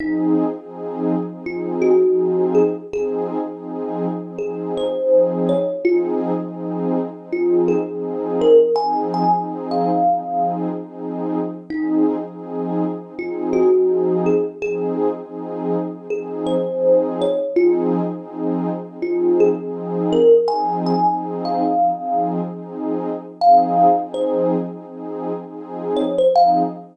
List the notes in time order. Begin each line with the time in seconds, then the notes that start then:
0.00 F3 C4 D#4 G#4
0.58 F3 C4 D#4 G#4
1.31 F3 C4 D#4 G#4
1.46 F3 C4 D#4 F4 G#4
1.82 F#4
2.04 F3 C4 D#4 G#4
2.55 G#4
2.93 F3 C4 D#4 G#4
3.50 F3 C4 D#4 G#4
4.23 F3 C4 D#4 G#4
4.38 F3 C4 D#4 G#4
4.77 C5
4.97 F3 C4 D#4 G#4
5.49 C#5
5.85 F3 C4 D#4 F4 G#4
6.43 F3 C4 D#4 G#4
7.16 F3 C4 D#4 G#4
7.30 F3 C4 D#4 F4 G#4
7.68 G#4
7.89 F3 C4 D#4 G#4
8.41 A#4
8.76 F3 C4 D#4 G#4 G#5
9.14 G#5
9.34 F3 C4 D#4 G#4
9.71 F5
10.10 F3 C4 D#4 G#4
10.24 F3 C4 D#4 G#4
10.82 F3 C4 D#4 G#4
11.70 F3 C4 D#4 G#4
12.28 F3 C4 D#4 G#4
13.01 F3 C4 D#4 G#4
13.18 F3 C4 D#4 F4 G#4
13.53 F#4
13.73 F3 C4 D#4 G#4
14.26 G#4
14.62 F3 C4 D#4 G#4
15.20 F3 C4 D#4 G#4
15.94 F3 C4 D#4 G#4
16.10 F3 C4 D#4 G#4
16.46 C5
16.67 F3 C4 D#4 G#4
17.21 C#5
17.55 F3 C4 D#4 F4 G#4
18.13 F3 C4 D#4 G#4
18.86 F3 C4 D#4 G#4
19.02 F3 C4 D#4 F4 G#4
19.40 G#4
19.60 F3 C4 D#4 G#4
20.12 A#4
20.48 F3 C4 D#4 G#4 G#5
20.86 G#5
21.06 F3 C4 D#4 G#4
21.45 F5
21.79 F3 C4 D#4 G#4
21.96 F3 C4 D#4 G#4
22.53 F3 C4 D#4 G#4
23.41 F3 C4 D#4 G#4 F5
23.99 F3 C4 D#4 G#4
24.14 C5
24.73 F3 C4 D#4 G#4
24.87 F3 C4 D#4 G#4
25.46 F3 C4 D#4 G#4
25.96 C#5
26.18 C5
26.36 F3 C4 D#4 G#4 F5